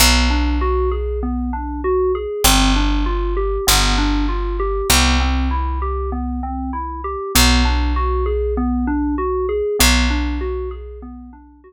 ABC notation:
X:1
M:4/4
L:1/8
Q:"Swing 16ths" 1/4=98
K:Bphr
V:1 name="Electric Piano 2"
B, D F ^G B, D F G | C D =F G B, D F G | B, C E G B, C E G | B, D F ^G B, D F G |
B, D F ^G B, D F z |]
V:2 name="Electric Bass (finger)" clef=bass
B,,,8 | G,,,4 G,,,4 | C,,8 | B,,,8 |
B,,,8 |]